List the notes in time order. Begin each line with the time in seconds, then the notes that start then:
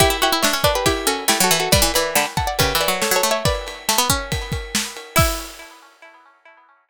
0.00 E4 G4, kick, ride
0.10 E4
0.22 E4 F#4 G4, ride
0.32 E4
0.43 D4 C#5 E5, snare
0.53 C#4
0.64 D4 B4 D5, kick, ride
0.75 G4 B4
0.86 E4 G4, kick, ride
1.07 C#4 F#4 A4, ride
1.28 A3 E4 G4, snare
1.40 F#3 F#4 A4
1.51 E3, ride
1.60 F#4 A4
1.72 G3 B4 D5, kick, ride
1.82 E3
1.94 E3 B4 D5, ride
2.15 D3 G5 B5, snare
2.37 F#5 A5, kick, ride
2.47 D5 F#5
2.59 C#3 G4 B4, kick, ride
2.75 E3
2.81 B4 D5, ride
2.88 F#3
3.02 A4 C#5, snare
3.11 F#3
3.16 A4 C#5
3.23 A3, ride
3.31 C#5 E5
3.45 B4 D5, kick, ride
3.68 ride
3.89 A3, snare
3.98 B3
4.10 C#4, kick, ride
4.32 kick, ride
4.52 kick, ride
4.75 snare
4.97 ride
5.16 E4 E5, kick, crash